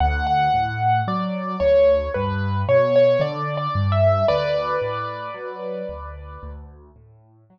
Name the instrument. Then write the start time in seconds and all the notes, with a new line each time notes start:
acoustic grand piano
0.00 D2 F#5
0.27 F#5
0.54 A2
1.07 F#3 D5
1.60 D2 C#5
2.14 G2 B4
2.68 B2 C#5
2.96 C#5
3.20 D3 D5
3.57 D5
3.75 G2
3.92 E5
4.28 D2 B4 D5
4.82 A2
5.34 F#3
5.89 D2
6.43 D2
6.96 A2
7.50 F#3